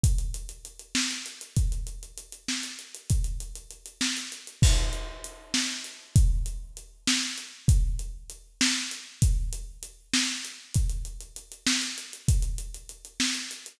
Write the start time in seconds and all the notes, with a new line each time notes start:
0.03 kick, closed hi-hat
0.18 closed hi-hat
0.34 closed hi-hat
0.49 closed hi-hat
0.65 closed hi-hat
0.79 closed hi-hat
0.95 snare
1.11 closed hi-hat
1.26 closed hi-hat
1.41 closed hi-hat
1.57 kick, closed hi-hat
1.72 closed hi-hat
1.87 closed hi-hat
2.03 closed hi-hat
2.17 closed hi-hat
2.32 closed hi-hat
2.48 snare
2.63 closed hi-hat
2.79 closed hi-hat
2.95 closed hi-hat
3.10 kick, closed hi-hat
3.24 closed hi-hat
3.40 closed hi-hat
3.55 closed hi-hat
3.71 closed hi-hat
3.86 closed hi-hat
4.01 snare
4.17 closed hi-hat
4.32 closed hi-hat
4.47 closed hi-hat
4.62 kick, crash
4.93 closed hi-hat
5.24 closed hi-hat
5.54 snare
5.84 closed hi-hat
6.16 kick, closed hi-hat
6.46 closed hi-hat
6.77 closed hi-hat
7.07 snare
7.38 closed hi-hat
7.68 kick, closed hi-hat
7.99 closed hi-hat
8.30 closed hi-hat
8.61 snare
8.91 closed hi-hat
9.22 kick, closed hi-hat
9.53 closed hi-hat
9.83 closed hi-hat
10.13 snare
10.45 closed hi-hat
10.74 kick, closed hi-hat
10.90 closed hi-hat
11.05 closed hi-hat
11.21 closed hi-hat
11.36 closed hi-hat
11.52 closed hi-hat
11.66 snare
11.82 closed hi-hat
11.98 closed hi-hat
12.13 closed hi-hat
12.28 kick, closed hi-hat
12.42 closed hi-hat
12.58 closed hi-hat
12.74 closed hi-hat
12.89 closed hi-hat
13.05 closed hi-hat
13.20 snare
13.35 closed hi-hat
13.51 closed hi-hat
13.66 closed hi-hat